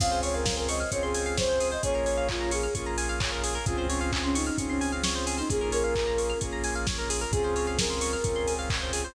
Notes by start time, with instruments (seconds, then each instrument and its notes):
0.00 synth bass 2 C#2, lead 2 (sawtooth) C4 C#4 F4 G#4, pizzicato strings G#4, pad 5 (bowed) C5 C#5 F5 G#5, ocarina F5, kick, crash
0.11 pizzicato strings C5
0.23 pizzicato strings C#5, ocarina C#5, open hi-hat
0.34 ocarina A#4, pizzicato strings F5
0.46 pizzicato strings G#5, kick, snare
0.57 ocarina A#4, pizzicato strings C6
0.69 ocarina D#5, pizzicato strings C#6, open hi-hat
0.80 pizzicato strings F6
0.92 synth bass 2 C#2, lead 2 (sawtooth) C4 C#4 F4 G#4, ocarina C#5, pizzicato strings C#6, kick, closed hi-hat
1.03 ocarina G#4, pizzicato strings C6
1.14 pizzicato strings G#5, open hi-hat
1.26 pizzicato strings F5
1.37 ocarina C5, pizzicato strings C#5, kick, snare
1.49 pizzicato strings C5
1.60 pizzicato strings G#4, open hi-hat
1.72 pizzicato strings C5, ocarina D#5
1.83 synth bass 2 A#1, lead 2 (sawtooth) A#3 C#4 F4 G#4, pizzicato strings G#4, pad 5 (bowed) A#4 C#5 F5 G#5, ocarina C#5, kick, closed hi-hat
1.95 pizzicato strings A#4
2.06 pizzicato strings C#5, open hi-hat
2.17 pizzicato strings F5
2.29 ocarina F4, pizzicato strings G#5, kick, clap
2.41 pizzicato strings A#5
2.51 ocarina G#4, pizzicato strings C#6, open hi-hat
2.63 pizzicato strings F6
2.74 synth bass 2 A#1, lead 2 (sawtooth) A#3 C#4 F4 G#4, pizzicato strings C#6, kick, closed hi-hat
2.86 pizzicato strings A#5
2.98 pizzicato strings G#5, open hi-hat
3.09 pizzicato strings F5
3.20 pizzicato strings C#5, kick, clap
3.32 pizzicato strings A#4
3.44 pizzicato strings G#4, open hi-hat
3.55 pizzicato strings A#4
3.66 synth bass 2 C#2, lead 2 (sawtooth) C4 C#4 F4 G#4, pad 5 (bowed) C4 C#4 F4 G#4, ocarina F4, pizzicato strings G#4, kick, closed hi-hat
3.78 pizzicato strings C5
3.89 ocarina C#4, pizzicato strings C#5, open hi-hat
4.01 ocarina C#4, pizzicato strings F5
4.12 pizzicato strings G#5, kick, clap
4.24 ocarina C#4, pizzicato strings C6
4.35 ocarina D#4, pizzicato strings C#6, open hi-hat
4.47 pizzicato strings F6
4.58 synth bass 2 C#2, lead 2 (sawtooth) C4 C#4 F4 G#4, ocarina C#4, pizzicato strings C#6, kick, closed hi-hat
4.69 ocarina C#4, pizzicato strings C6
4.81 pizzicato strings G#5, open hi-hat
4.92 pizzicato strings F5
5.04 ocarina C#4, pizzicato strings C#5, snare
5.15 pizzicato strings C5
5.27 pizzicato strings G#4, open hi-hat
5.38 ocarina D#4, pizzicato strings C5
5.50 synth bass 2 A#1, lead 2 (sawtooth) A#3 C#4 F4 G#4, pad 5 (bowed) A#3 C#4 F4 G#4, pizzicato strings G#4, ocarina G#4, kick, closed hi-hat
5.61 pizzicato strings A#4
5.72 ocarina A#4, pizzicato strings C#5, open hi-hat
5.84 pizzicato strings F5
5.95 pizzicato strings G#5, kick, clap
6.07 pizzicato strings A#5
6.18 pizzicato strings C#6, open hi-hat
6.30 pizzicato strings F6
6.41 synth bass 2 A#1, lead 2 (sawtooth) A#3 C#4 F4 G#4, pizzicato strings C#6, kick, closed hi-hat
6.53 pizzicato strings A#5
6.64 pizzicato strings G#5, open hi-hat
6.75 pizzicato strings F5
6.87 pizzicato strings C#5, kick, snare
6.98 pizzicato strings A#4
7.10 pizzicato strings G#4, open hi-hat
7.21 pizzicato strings A#4
7.31 synth bass 2 C#2, pad 5 (bowed) C4 C#4 F4 G#4, lead 2 (sawtooth) C4 C#4 F4 G#4, ocarina G#4, pizzicato strings G#4, kick, closed hi-hat
7.44 pizzicato strings C5
7.56 pizzicato strings C#5, open hi-hat
7.67 pizzicato strings F5
7.78 ocarina A#4, pizzicato strings G#5, kick, snare
7.90 pizzicato strings C6
8.01 pizzicato strings C#6, open hi-hat
8.13 pizzicato strings F6
8.24 synth bass 2 C#2, lead 2 (sawtooth) C4 C#4 F4 G#4, pizzicato strings C#6, kick, closed hi-hat
8.36 pizzicato strings C6
8.47 pizzicato strings G#5, open hi-hat
8.59 pizzicato strings F5
8.70 pizzicato strings C#5, kick, clap
8.82 pizzicato strings C5
8.93 pizzicato strings G#4, open hi-hat
9.05 pizzicato strings C5